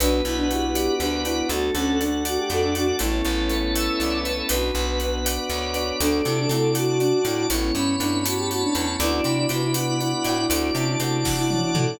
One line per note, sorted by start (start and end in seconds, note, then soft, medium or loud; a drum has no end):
0.00 0.22 B1 loud
0.00 0.17 B3 medium
0.00 1.48 B3 medium
0.00 1.48 D4 medium
0.00 0.21 D4 medium
0.00 0.17 D4 loud
0.00 1.48 F#4 medium
0.00 0.17 F#4 loud
0.00 0.46 B4 loud
0.00 0.50 B4 loud
0.00 closed hi-hat loud
0.25 0.89 B1 medium
0.25 0.37 E4 medium
0.25 1.25 F#5 medium
0.25 closed hi-hat medium
0.37 0.48 D4 medium
0.49 0.66 B3 medium
0.49 0.66 D4 loud
0.49 0.93 E4 medium
0.49 0.66 F#4 medium
0.49 0.94 G4 medium
0.49 1.00 B4 medium
0.49 closed hi-hat medium
0.75 1.46 D5 medium
0.75 closed hi-hat loud
1.00 1.43 D2 medium
1.00 1.24 D4 medium
1.00 1.48 B4 loud
1.00 closed hi-hat medium
1.24 1.33 B3 medium
1.24 1.33 D4 medium
1.24 1.47 E4 medium
1.24 1.33 F#4 medium
1.24 1.49 F#5 medium
1.24 closed hi-hat medium
1.49 1.71 D2 medium
1.49 2.99 A3 medium
1.49 1.68 A3 loud
1.49 2.99 D4 medium
1.49 1.68 D4 loud
1.49 2.99 F#4 medium
1.49 1.71 F#4 medium
1.49 1.68 F#4 loud
1.49 2.00 A4 loud
1.49 closed hi-hat loud
1.75 2.38 D2 medium
1.75 1.99 C#4 medium
1.75 1.97 A4 loud
1.75 2.75 F#5 medium
1.75 closed hi-hat medium
1.99 2.16 A3 medium
1.99 2.16 D4 medium
1.99 2.23 D4 medium
1.99 2.16 F#4 medium
1.99 2.49 A4 medium
1.99 closed hi-hat medium
2.25 2.38 F#4 loud
2.25 2.96 D5 medium
2.25 closed hi-hat loud
2.37 2.49 G4 medium
2.50 2.92 F2 medium
2.50 2.62 F#4 medium
2.50 2.97 A4 medium
2.50 2.74 A4 loud
2.50 closed hi-hat medium
2.63 2.74 D4 medium
2.74 2.83 A3 medium
2.74 2.87 D4 medium
2.74 2.83 D4 medium
2.74 2.97 F#4 loud
2.74 2.83 F#4 loud
2.74 2.99 F#5 medium
2.74 closed hi-hat medium
2.99 3.22 A1 medium
2.99 4.49 A3 medium
2.99 3.18 A3 loud
2.99 4.49 B3 medium
2.99 3.18 B3 loud
2.99 4.49 C#4 medium
2.99 4.49 E4 medium
2.99 4.18 E4 medium
2.99 4.00 A4 loud
2.99 3.73 C#5 loud
2.99 closed hi-hat loud
3.04 3.18 C#4 medium
3.04 3.18 E4 loud
3.25 3.89 A1 medium
3.25 4.24 B4 medium
3.25 closed hi-hat medium
3.49 3.68 A3 medium
3.49 3.68 B3 medium
3.49 3.68 C#4 medium
3.49 4.45 C#5 medium
3.49 closed hi-hat medium
3.54 3.68 E4 medium
3.75 3.96 E5 loud
3.75 4.46 E5 medium
3.75 closed hi-hat loud
4.00 4.42 C2 medium
4.00 4.47 A4 medium
4.00 4.21 D5 loud
4.00 closed hi-hat medium
4.25 4.34 A3 medium
4.25 4.34 B3 medium
4.25 4.34 C#4 medium
4.25 4.49 B4 medium
4.25 5.35 B4 loud
4.25 closed hi-hat medium
4.30 4.34 E4 medium
4.49 4.71 B1 medium
4.49 5.99 B3 medium
4.49 4.68 B3 loud
4.49 5.99 D4 medium
4.49 4.68 D4 loud
4.49 5.99 F#4 medium
4.49 4.99 B4 loud
4.49 closed hi-hat loud
4.53 4.68 F#4 loud
4.75 5.38 B1 medium
4.75 5.93 F#5 medium
4.75 closed hi-hat medium
5.00 5.19 B3 medium
5.00 5.19 D4 medium
5.00 5.49 B4 medium
5.00 closed hi-hat medium
5.04 5.19 F#4 medium
5.25 5.75 D5 medium
5.25 closed hi-hat loud
5.49 5.92 D2 medium
5.49 5.97 B4 medium
5.49 5.99 C#5 loud
5.49 closed hi-hat medium
5.74 5.83 B3 medium
5.74 5.83 D4 medium
5.74 5.83 F#4 medium
5.74 6.49 D5 loud
5.74 closed hi-hat medium
6.00 6.22 D2 medium
6.00 7.48 A3 medium
6.00 6.18 A3 loud
6.00 7.48 D4 medium
6.00 6.22 D4 loud
6.00 6.18 D4 loud
6.00 7.48 F#4 medium
6.00 6.18 F#4 medium
6.00 6.72 A4 loud
6.00 closed hi-hat loud
6.25 6.47 C3 medium
6.25 6.37 E4 medium
6.25 7.25 A5 medium
6.25 closed hi-hat medium
6.37 6.49 D4 medium
6.49 7.13 C3 medium
6.49 6.68 A3 loud
6.49 6.68 D4 loud
6.49 6.97 E4 medium
6.49 6.99 D5 medium
6.49 closed hi-hat loud
6.54 6.68 F#4 medium
6.75 7.41 F#4 loud
6.75 7.46 F#5 medium
6.75 closed hi-hat loud
6.99 7.20 D4 medium
6.99 7.47 D5 loud
6.99 closed hi-hat medium
7.24 7.46 A2 medium
7.24 7.34 A3 medium
7.24 7.34 D4 medium
7.24 7.47 E4 medium
7.24 7.49 A5 medium
7.24 closed hi-hat loud
7.29 7.34 F#4 medium
7.49 7.71 A1 medium
7.49 8.98 A3 medium
7.49 7.69 A3 loud
7.49 8.98 B3 medium
7.49 7.69 B3 loud
7.49 8.98 C#4 medium
7.49 7.73 E4 medium
7.49 8.98 E4 medium
7.49 8.00 C#5 loud
7.49 closed hi-hat loud
7.54 7.69 C#4 loud
7.54 7.69 E4 loud
7.74 7.96 G2 medium
7.74 7.95 C#4 medium
7.74 8.74 B5 loud
7.74 closed hi-hat medium
7.99 8.64 G2 medium
7.99 8.17 A3 medium
7.99 8.17 B3 medium
7.99 8.17 C#4 medium
7.99 8.23 D4 medium
7.99 8.50 C#5 medium
7.99 closed hi-hat medium
8.04 8.17 E4 medium
8.25 8.37 F#4 medium
8.25 8.96 A5 medium
8.25 closed hi-hat loud
8.37 8.49 G4 medium
8.50 8.62 F#4 medium
8.50 8.97 C#5 loud
8.50 closed hi-hat medium
8.62 8.74 D4 medium
8.75 8.96 E2 medium
8.75 8.84 A3 medium
8.75 8.84 B3 medium
8.75 8.84 C#4 medium
8.75 8.87 D4 medium
8.75 8.99 B5 medium
8.75 closed hi-hat medium
8.79 8.84 E4 medium
9.00 9.21 D2 loud
9.00 10.48 B3 medium
9.00 9.18 B3 medium
9.00 9.46 D4 loud
9.00 10.48 D4 medium
9.00 9.18 D4 loud
9.00 9.12 E4 loud
9.00 10.48 F#4 medium
9.00 9.18 F#4 loud
9.00 9.49 D5 loud
9.00 closed hi-hat loud
9.13 9.24 E4 medium
9.24 9.46 C3 medium
9.24 9.37 E4 medium
9.24 10.44 B5 medium
9.24 closed hi-hat medium
9.38 9.50 E4 medium
9.49 10.14 C3 medium
9.49 9.67 B3 medium
9.49 9.98 B3 medium
9.49 9.67 D4 medium
9.49 9.62 E4 medium
9.49 9.67 F#4 medium
9.49 10.00 D5 medium
9.49 closed hi-hat loud
9.63 9.75 E4 medium
9.74 9.86 E4 medium
9.74 10.46 F#5 medium
9.74 closed hi-hat loud
9.87 9.99 E4 medium
10.00 10.12 E4 medium
10.00 10.25 D5 medium
10.00 closed hi-hat medium
10.12 10.24 E4 medium
10.24 10.46 A2 medium
10.24 10.34 B3 medium
10.24 10.34 D4 medium
10.24 10.37 E4 medium
10.24 10.34 F#4 loud
10.24 11.00 D5 loud
10.24 closed hi-hat medium
10.38 10.73 E4 medium
10.50 10.71 D2 medium
10.50 11.98 A3 medium
10.50 10.68 A3 loud
10.50 11.98 D4 medium
10.50 10.68 D4 loud
10.50 11.98 F#4 medium
10.50 10.68 F#4 loud
10.50 closed hi-hat loud
10.75 10.96 C3 medium
10.75 10.95 C#4 loud
10.75 10.87 E4 medium
10.75 11.75 A5 medium
10.75 closed hi-hat medium
10.88 10.99 E4 medium
11.00 11.64 C3 medium
11.00 11.18 A3 medium
11.00 11.18 D4 medium
11.00 11.35 E4 medium
11.00 11.18 F#4 loud
11.00 11.49 D5 medium
11.00 closed hi-hat loud
11.25 11.96 F#5 medium
11.25 kick loud
11.25 snare medium
11.38 11.49 E4 loud
11.50 11.71 C#4 medium
11.50 11.61 E4 medium
11.50 11.97 D5 loud
11.50 high tom medium
11.63 11.74 E4 medium
11.75 11.96 A2 medium
11.75 11.84 A3 medium
11.75 11.97 A3 loud
11.75 11.84 D4 medium
11.75 11.87 E4 medium
11.75 11.84 F#4 loud
11.75 11.99 A5 medium
11.75 mid tom loud
11.88 11.99 E4 medium